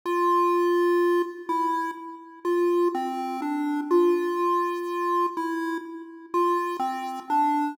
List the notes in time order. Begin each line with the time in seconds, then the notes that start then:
0.05 F4
1.49 E4
2.45 F4
2.95 C4
3.42 D4
3.91 F4
5.37 E4
6.34 F4
6.79 C4
7.30 D4